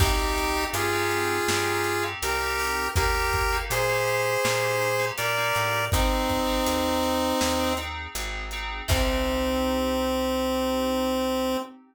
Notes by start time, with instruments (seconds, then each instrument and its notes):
0.00 electric bass (finger) C2, electric piano 2 C4 D#4 G4, lead 1 (square) D#4 G4, kick, crash
0.19 electric piano 2 C4 D#4 G4
0.38 closed hi-hat
0.57 electric piano 2 C4 D#4 G4
0.73 electric bass (finger) G2, lead 1 (square) F4 G#4, closed hi-hat
0.93 electric piano 2 C4 D#4 G4
1.11 closed hi-hat
1.48 electric bass (finger) G2, electric piano 2 C4 D#4 G4, snare
1.84 closed hi-hat
2.03 electric piano 2 C4 D#4 G4
2.22 electric bass (finger) C2, electric piano 2 C4 D#4 G4, lead 1 (square) G4 A#4, closed hi-hat
2.41 electric piano 2 C4 D#4 G4
2.59 open hi-hat
2.96 electric bass (finger) D#2, electric piano 2 A#3 D#4 G4, lead 1 (square) G4 A#4, kick, closed hi-hat
3.14 electric piano 2 A#3 D#4 G4
3.33 kick, closed hi-hat
3.52 electric piano 2 A#3 D#4 G4
3.70 electric bass (finger) A#2, lead 1 (square) G#4 C5, closed hi-hat
3.89 electric piano 2 A#3 D#4 G4
4.08 closed hi-hat
4.44 electric bass (finger) A#2, electric piano 2 A#3 D#4 G4, snare
4.82 closed hi-hat
4.99 electric piano 2 A#3 D#4 G4
5.18 electric bass (finger) A#2, electric piano 2 A#3 D#4 G4, lead 1 (square) A#4 D5, closed hi-hat
5.37 electric piano 2 A#3 D#4 G4
5.55 electric bass (finger) A2, closed hi-hat
5.92 electric bass (finger) G#1, lead 1 (square) C4 D#4, electric piano 2 C4 D#4 G#4, kick, closed hi-hat
6.29 kick, closed hi-hat
6.47 electric piano 2 C4 D#4 G#4
6.67 electric bass (finger) D#2, closed hi-hat
7.03 closed hi-hat
7.41 electric bass (finger) D#2, snare
7.60 electric piano 2 C4 D#4 G#4
7.77 electric piano 2 C4 D#4 G#4, closed hi-hat
8.15 electric bass (finger) G#1, electric piano 2 C4 D#4 G#4, closed hi-hat
8.51 electric piano 2 C4 D#4 G#4, closed hi-hat
8.88 electric bass (finger) C2, electric piano 2 C4 D#4 G4, lead 1 (square) C4, kick, crash